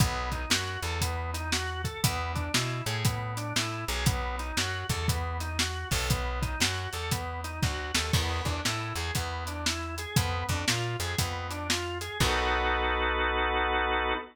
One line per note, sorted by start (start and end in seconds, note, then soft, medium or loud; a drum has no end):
0.00 0.46 B1 medium
0.00 0.29 B3 loud
0.00 kick loud
0.00 closed hi-hat loud
0.32 0.49 D#4 medium
0.32 kick medium
0.32 closed hi-hat medium
0.50 0.78 F#2 medium
0.50 0.80 F#4 medium
0.50 snare loud
0.83 1.89 E2 medium
0.83 0.99 A4 medium
0.83 closed hi-hat medium
1.01 1.31 B3 medium
1.01 kick medium
1.01 closed hi-hat loud
1.34 1.50 D#4 medium
1.34 closed hi-hat medium
1.52 1.82 F#4 medium
1.52 snare loud
1.84 2.01 A4 medium
1.84 kick medium
1.84 closed hi-hat medium
2.03 2.49 E2 medium
2.03 2.32 B3 medium
2.03 kick loud
2.03 closed hi-hat loud
2.35 2.52 D4 medium
2.35 kick medium
2.35 closed hi-hat medium
2.54 2.82 B2 medium
2.54 2.83 E4 medium
2.54 snare loud
2.86 3.53 A2 medium
2.86 3.03 G#4 medium
2.86 closed hi-hat medium
3.05 3.34 B3 medium
3.05 kick loud
3.05 closed hi-hat loud
3.37 3.54 D4 medium
3.37 closed hi-hat medium
3.56 3.85 A2 medium
3.56 3.85 E4 medium
3.56 snare loud
3.88 4.52 B1 medium
3.88 4.05 G#4 medium
3.88 closed hi-hat medium
4.06 4.36 B3 medium
4.06 kick loud
4.06 closed hi-hat loud
4.39 4.56 D#4 medium
4.39 closed hi-hat medium
4.57 4.84 F#2 medium
4.57 4.86 F#4 medium
4.57 snare loud
4.90 5.85 E2 medium
4.90 5.07 A4 medium
4.90 kick loud
4.90 closed hi-hat medium
5.08 5.37 B3 medium
5.08 kick loud
5.08 closed hi-hat loud
5.40 5.57 D#4 medium
5.40 closed hi-hat medium
5.59 5.89 F#4 medium
5.59 snare loud
5.91 6.56 B1 medium
5.91 6.08 A4 medium
5.91 kick loud
5.91 open hi-hat medium
6.10 6.39 B3 medium
6.10 kick loud
6.10 closed hi-hat loud
6.42 6.59 D#4 medium
6.42 kick loud
6.42 closed hi-hat medium
6.60 6.88 F#2 medium
6.60 6.90 F#4 medium
6.60 snare loud
6.93 7.60 E2 medium
6.93 7.10 A4 medium
6.93 closed hi-hat medium
7.11 7.41 B3 medium
7.11 kick loud
7.11 closed hi-hat loud
7.44 7.61 D#4 medium
7.44 closed hi-hat medium
7.63 7.92 D2 medium
7.63 7.92 F#4 medium
7.63 kick loud
7.63 snare medium
7.94 8.12 D#2 medium
7.94 8.12 A4 medium
7.94 snare loud
8.13 8.41 E2 medium
8.13 8.43 B3 medium
8.13 kick loud
8.13 crash loud
8.45 8.61 E2 medium
8.45 8.62 D4 medium
8.45 kick loud
8.45 closed hi-hat medium
8.65 8.93 A2 medium
8.65 8.94 E4 medium
8.65 snare loud
8.96 9.11 E2 medium
8.96 9.13 G#4 medium
8.96 closed hi-hat medium
9.15 10.06 E2 medium
9.15 9.44 B3 medium
9.15 kick medium
9.15 closed hi-hat loud
9.47 9.65 D4 medium
9.47 closed hi-hat medium
9.66 9.95 E4 medium
9.66 snare loud
9.98 10.15 G#4 medium
9.98 closed hi-hat medium
10.16 10.44 F2 medium
10.16 10.46 B3 medium
10.16 kick loud
10.16 closed hi-hat loud
10.49 10.65 F2 medium
10.49 10.66 D4 medium
10.49 kick medium
10.49 closed hi-hat medium
10.68 10.96 A#2 medium
10.68 10.97 F4 medium
10.68 snare loud
11.00 11.16 F2 medium
11.00 11.17 G#4 medium
11.00 closed hi-hat medium
11.18 12.09 F2 medium
11.18 11.47 B3 medium
11.18 kick loud
11.18 closed hi-hat loud
11.51 11.67 D4 medium
11.51 closed hi-hat medium
11.69 11.98 F4 medium
11.69 snare loud
12.01 12.18 G#4 medium
12.01 closed hi-hat medium
12.20 14.14 B1 loud
12.20 14.14 B3 loud
12.20 14.14 D#4 loud
12.20 14.14 F#4 loud
12.20 14.14 A4 loud
12.20 kick loud
12.20 crash loud